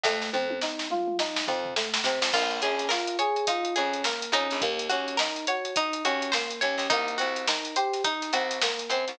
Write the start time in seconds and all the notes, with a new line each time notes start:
0.03 F2 A3, kick, snare
0.22 snare
0.33 F2 C4, high tom
0.50 high tom
0.61 D#4, snare
0.79 snare
0.90 F4, mid tom
1.08 mid tom
1.19 D#4, snare
1.36 snare
1.47 F2 C4, floor tom
1.65 floor tom
1.76 A3, snare
1.94 snare
2.04 C3 C4, snare
2.22 F2, snare
2.33 A#1 A#3 F4, kick, crash
2.51 closed hi-hat
2.62 A#1 C#4 G#4, closed hi-hat
2.79 snare, closed hi-hat
2.89 F4 A#4, snare
3.07 closed hi-hat
3.19 G#4 C#5, closed hi-hat
3.36 closed hi-hat
3.47 D#4 F4, kick, closed hi-hat
3.65 closed hi-hat
3.76 F2 C#4 G#4, closed hi-hat
3.93 closed hi-hat
4.04 A#3 A#4, snare
4.22 closed hi-hat
4.32 F2 C#4 D#4, closed hi-hat
4.50 A#1, snare, closed hi-hat
4.61 D#2 A#3, kick, closed hi-hat
4.79 closed hi-hat
4.89 D#2 C#4 F#4, closed hi-hat
5.08 closed hi-hat
5.17 D#4 A#4, snare
5.36 closed hi-hat
5.47 F#4 C#5, closed hi-hat
5.65 closed hi-hat
5.76 D#4, kick, closed hi-hat
5.93 closed hi-hat
6.05 D#2 C#4 F#4, closed hi-hat
6.22 closed hi-hat
6.32 A#3 C5, snare
6.50 closed hi-hat
6.61 D#2 C#4 C#5, closed hi-hat
6.78 D#2, snare, closed hi-hat
6.90 C2 A#3 D#4, kick, closed hi-hat
7.08 closed hi-hat
7.18 C2 C4 F#4, closed hi-hat
7.36 closed hi-hat
7.47 D#4 A#4, snare
7.65 closed hi-hat
7.76 G4 C5, closed hi-hat
7.93 snare, closed hi-hat
8.04 D#4, kick, closed hi-hat
8.22 snare, closed hi-hat
8.33 C2 C4 F#4, closed hi-hat
8.51 snare, closed hi-hat
8.62 A#3 A#4, snare
8.79 closed hi-hat
8.89 F#2 C4 C5, closed hi-hat
9.08 C2, snare, closed hi-hat